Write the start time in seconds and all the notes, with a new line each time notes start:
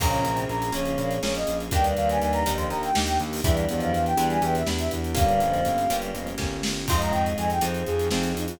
0.00 A#1 C#3 A#3 C#4 F4 G#4 A#5, kick, crash
0.13 closed hi-hat
0.24 A#1 C3 C4, closed hi-hat
0.37 closed hi-hat
0.49 A#1 A#5, closed hi-hat
0.62 closed hi-hat
0.72 A#1 C#3 A#3 C#4 F4 G#4 C#5, closed hi-hat
0.85 closed hi-hat
0.98 A#1 A#2 A#3, closed hi-hat
1.11 closed hi-hat
1.22 A#1 A#3 C#4 F4 G#4 C#5, snare
1.35 D#5, closed hi-hat
1.47 A#1, closed hi-hat
1.60 closed hi-hat
1.71 D#2 G2 G3 A#3 D4 D#4 G4 G5, kick, closed hi-hat
1.84 closed hi-hat
1.97 D#2 F5, closed hi-hat
2.09 G#5, closed hi-hat
2.20 D#2 G#5, closed hi-hat
2.33 A#5, closed hi-hat
2.45 D#2 F2 F3 A#3 D4 D#4 G4, closed hi-hat
2.57 C6, closed hi-hat
2.69 D#2 A#5, closed hi-hat
2.83 G5, closed hi-hat
2.95 D#2 A#3 D4 D#4 G4, snare
3.06 G5, closed hi-hat
3.20 D#2, closed hi-hat
3.33 open hi-hat
3.43 E2 G2 G3 B3 D4 E4 G4 E5, kick, closed hi-hat
3.57 closed hi-hat
3.69 E2 F2 F3 D5, closed hi-hat
3.80 F5, closed hi-hat
3.92 E2 F5, closed hi-hat
4.06 G5, closed hi-hat
4.17 E2 G2 G3 B3 D4 E4 G4, closed hi-hat
4.30 G#5, closed hi-hat
4.42 E2 E3 G5, closed hi-hat
4.55 E5, closed hi-hat
4.66 E2 B3 D4 E4 G4, snare
4.79 E5, closed hi-hat
4.91 E2, closed hi-hat
5.04 closed hi-hat
5.15 G1 G2 G3 A#3 C#4 F4 G4 F5, kick, closed hi-hat
5.28 closed hi-hat
5.40 G1 F2 F3, closed hi-hat
5.54 closed hi-hat
5.65 G1, closed hi-hat
5.78 closed hi-hat
5.90 G1 G2 G3 A#3 C#4 F4 G4, closed hi-hat
6.02 closed hi-hat
6.14 G1 F2 F3, closed hi-hat
6.27 closed hi-hat
6.38 G1 A#3 C#4 F4 G4, kick, snare
6.63 G1, snare
6.88 F2 G#2 G#3 C4 D#4 F4 G#4 C6, kick, crash
7.01 A#5, closed hi-hat
7.11 F2 G5, closed hi-hat
7.26 closed hi-hat
7.38 F2 G#5, closed hi-hat
7.50 G5, closed hi-hat
7.61 F2 C4 D#4 F4 G#4 C5, closed hi-hat
7.74 closed hi-hat
7.86 F2 G#4, closed hi-hat
7.99 closed hi-hat
8.11 F2 C4 D#4 F4 G#4, snare
8.23 closed hi-hat
8.35 F2 D#4, closed hi-hat
8.48 F4, closed hi-hat